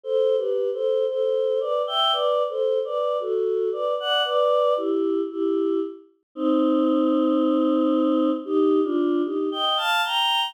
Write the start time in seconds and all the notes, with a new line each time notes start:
0.04 A4 C5
0.37 G4 B4
0.73 A4 C5
1.08 A4 C5
1.60 B4 D5
1.87 E5 G5
2.12 B4 D5
2.49 A4 C5
2.85 B4 D5
3.20 F#4 A4
3.72 B4 D5
4.00 D5 F#5
4.24 B4 D5
4.77 E4 G4
5.30 E4 G4
6.35 C4 D#4
8.45 D#4 G4
8.84 D4 F4
9.24 D#4 G4
9.52 D#5 G5
9.77 F5 A5
10.04 G5 A#5